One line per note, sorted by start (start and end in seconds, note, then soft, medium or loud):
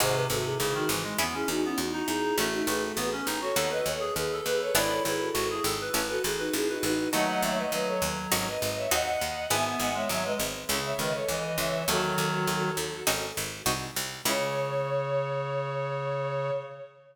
0.00 0.26 G#1 medium
0.00 0.27 C3 loud
0.00 1.17 C4 medium
0.00 1.17 D#4 medium
0.00 1.17 F#4 medium
0.00 0.14 G#4 medium
0.00 1.17 G#4 medium
0.00 0.14 C5 medium
0.14 0.29 B4 medium
0.29 0.55 G#1 medium
0.29 0.57 C3 medium
0.29 0.44 F#4 medium
0.29 0.44 A4 medium
0.45 0.59 E4 medium
0.45 0.59 G#4 medium
0.59 0.85 G#1 medium
0.59 0.74 C#3 loud
0.59 0.73 E4 medium
0.59 0.73 G#4 medium
0.74 0.88 D#3 loud
0.74 0.88 D#4 medium
0.74 0.88 F#4 medium
0.89 1.14 G#1 medium
0.89 1.04 E3 medium
1.03 1.17 G#3 loud
1.18 1.44 E2 medium
1.18 1.35 B3 loud
1.18 2.35 C#4 medium
1.18 2.35 E4 loud
1.18 2.35 G#4 medium
1.34 1.49 C#4 medium
1.34 1.48 E4 medium
1.34 1.48 G#4 medium
1.48 1.73 E2 medium
1.48 1.62 D#4 medium
1.48 1.62 F#4 medium
1.63 1.79 B3 loud
1.63 1.77 C#4 medium
1.63 1.77 E4 medium
1.78 2.03 E2 medium
1.78 1.92 D#4 medium
1.78 1.92 F#4 medium
1.93 2.07 D#4 loud
1.93 2.07 D#4 medium
1.93 2.07 F#4 medium
2.08 2.33 E2 medium
2.08 2.36 D#4 loud
2.08 2.36 E4 medium
2.08 2.36 G#4 medium
2.37 2.63 A1 medium
2.37 2.66 A3 loud
2.37 3.54 C#4 medium
2.37 2.51 F#4 medium
2.37 3.54 F#4 medium
2.37 2.51 A4 medium
2.37 3.54 A4 loud
2.53 2.67 D#4 medium
2.53 2.67 F#4 medium
2.67 2.92 A1 medium
2.67 2.92 A3 loud
2.67 2.81 G#4 medium
2.67 2.81 B4 medium
2.82 2.96 F#4 medium
2.82 2.96 A4 medium
2.96 3.22 A1 medium
2.96 3.10 B3 loud
2.96 3.11 G#4 medium
2.96 3.11 B4 medium
3.12 3.26 C#4 loud
3.26 3.52 A1 medium
3.26 3.40 D#4 loud
3.41 3.55 F#4 loud
3.41 3.69 A4 medium
3.41 3.69 C#5 medium
3.56 3.81 D#2 medium
3.56 4.73 B3 medium
3.56 4.73 D#4 medium
3.56 4.73 F#4 medium
3.56 3.70 A4 loud
3.70 3.85 B4 medium
3.70 3.85 D#5 medium
3.86 4.11 D#2 medium
3.86 4.00 A4 medium
3.86 4.00 C#5 medium
4.00 4.14 G#4 loud
4.16 4.41 D#2 medium
4.16 4.40 G#4 medium
4.16 4.40 B4 medium
4.33 4.47 A4 loud
4.46 4.71 D#2 medium
4.46 4.60 G#4 medium
4.46 4.75 B4 loud
4.46 4.60 B4 medium
4.61 4.75 A4 medium
4.61 4.75 C#5 medium
4.75 5.00 G#1 loud
4.75 5.91 B3 loud
4.75 5.91 D4 medium
4.75 5.91 E4 loud
4.75 5.03 E4 loud
4.75 5.91 G#4 medium
4.75 4.89 B4 medium
4.75 4.89 D5 medium
4.90 5.04 A4 medium
4.90 5.04 C#5 medium
5.04 5.30 G#1 medium
5.04 5.29 E4 loud
5.04 5.19 G#4 medium
5.04 5.19 B4 medium
5.20 5.34 F#4 medium
5.20 5.34 A4 medium
5.34 5.60 G#1 medium
5.34 5.48 F#4 loud
5.34 5.49 F#4 medium
5.34 5.49 A4 medium
5.49 5.63 E4 medium
5.49 5.63 G#4 medium
5.49 5.64 G#4 loud
5.64 5.89 G#1 medium
5.64 5.79 A4 loud
5.81 5.94 B4 loud
5.94 6.19 A1 medium
5.94 7.11 C#4 medium
5.94 7.11 E4 medium
5.94 7.11 A4 medium
5.94 6.08 B4 loud
6.08 6.23 F#4 medium
6.08 6.23 A4 medium
6.08 6.22 B4 loud
6.24 6.50 A1 medium
6.24 6.38 E4 medium
6.24 6.38 G#4 medium
6.38 6.52 D#4 medium
6.38 6.52 F#4 medium
6.38 6.53 B4 loud
6.53 6.79 A1 medium
6.53 6.67 E4 medium
6.53 6.67 G#4 medium
6.68 6.82 D#4 medium
6.68 6.82 F#4 medium
6.68 6.83 B4 medium
6.83 7.08 A1 medium
6.83 7.09 D#4 medium
6.83 7.09 F#4 medium
6.83 7.09 B4 loud
7.13 7.39 D#2 medium
7.13 7.63 F#3 loud
7.13 7.63 A3 loud
7.13 8.29 D#4 medium
7.13 8.29 F#4 medium
7.13 8.29 A4 medium
7.13 7.27 D#5 medium
7.13 7.27 F#5 medium
7.27 7.41 D#5 medium
7.27 7.41 F#5 medium
7.42 7.68 D#2 medium
7.42 7.57 C#5 medium
7.42 7.57 E5 medium
7.57 7.71 B4 medium
7.57 7.71 D#5 medium
7.72 7.97 D#2 medium
7.72 8.48 F#3 medium
7.72 7.86 B4 medium
7.72 7.86 D#5 medium
7.87 8.01 A4 medium
7.87 8.01 C#5 medium
8.02 8.27 D#2 medium
8.32 8.57 G#1 medium
8.32 8.90 C#4 loud
8.32 8.90 D#4 medium
8.32 8.90 F#4 medium
8.32 8.90 G#4 medium
8.47 8.61 B4 medium
8.47 8.61 D#5 medium
8.61 8.87 G#1 medium
8.61 8.75 B4 medium
8.61 8.75 D#5 medium
8.76 8.91 C#5 medium
8.76 8.91 E5 medium
8.91 9.17 D#2 loud
8.91 9.50 C4 medium
8.91 9.50 D#4 medium
8.91 9.50 F#4 medium
8.91 9.50 G#4 medium
8.91 9.44 D#5 medium
8.91 9.44 F#5 medium
9.21 9.47 D#2 medium
9.50 9.76 G#1 medium
9.50 10.67 B3 medium
9.50 9.90 B3 loud
9.50 10.67 E4 medium
9.50 10.67 G#4 medium
9.50 9.64 E5 medium
9.50 9.64 G#5 medium
9.66 9.80 E5 medium
9.66 9.80 G#5 medium
9.80 10.05 G#1 medium
9.80 9.94 D#5 medium
9.80 9.94 F#5 medium
9.94 10.08 G#3 medium
9.94 10.09 C#5 medium
9.94 10.09 E5 medium
10.09 10.35 G#1 medium
10.09 10.24 F#3 loud
10.09 10.24 C#5 medium
10.09 10.24 E5 medium
10.25 10.39 G#3 medium
10.25 10.39 B4 medium
10.25 10.39 D#5 medium
10.39 10.65 G#1 medium
10.69 10.94 C#2 loud
10.69 10.93 C#3 medium
10.69 11.85 C#4 loud
10.69 11.85 E4 medium
10.69 11.85 A4 medium
10.84 10.98 C#5 medium
10.84 10.98 E5 medium
10.99 11.24 C#2 medium
10.99 11.13 D#3 loud
10.99 11.13 B4 medium
10.99 11.13 D#5 medium
11.14 11.28 A4 medium
11.14 11.28 C#5 medium
11.28 11.54 C#2 medium
11.28 11.57 E3 medium
11.28 11.43 B4 medium
11.28 11.43 D#5 medium
11.44 11.58 B4 medium
11.44 11.58 D#5 medium
11.58 11.83 C#2 medium
11.58 11.85 E3 medium
11.58 11.83 C#5 medium
11.58 11.83 E5 medium
11.88 12.13 D#2 loud
11.88 12.71 D#3 loud
11.88 12.71 F#3 loud
11.88 13.05 D#4 medium
11.88 13.05 F#4 medium
11.88 13.05 F#4 loud
11.88 13.05 A4 medium
11.88 13.05 A4 loud
12.18 12.43 D#2 medium
12.47 12.73 D#2 medium
12.77 13.02 D#2 medium
13.07 13.32 G#1 loud
13.07 13.65 C#4 medium
13.07 13.65 D#4 medium
13.07 13.65 F#4 medium
13.07 13.65 G#4 medium
13.37 13.62 G#1 medium
13.66 13.91 C2 loud
13.66 14.24 C4 medium
13.66 14.24 D#4 medium
13.66 14.24 F#4 medium
13.66 14.24 G#4 medium
13.96 14.22 C2 medium
14.25 16.50 C#2 loud
14.25 16.51 C#3 loud
14.25 16.51 C#4 loud
14.25 16.51 E4 loud
14.25 16.51 G#4 loud
14.25 16.51 C#5 loud